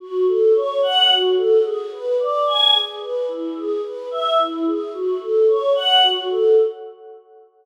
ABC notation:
X:1
M:6/8
L:1/8
Q:3/8=73
K:F#m
V:1 name="Choir Aahs"
F A c f F A | G B d g G B | E G B e E G | F A c f F A |]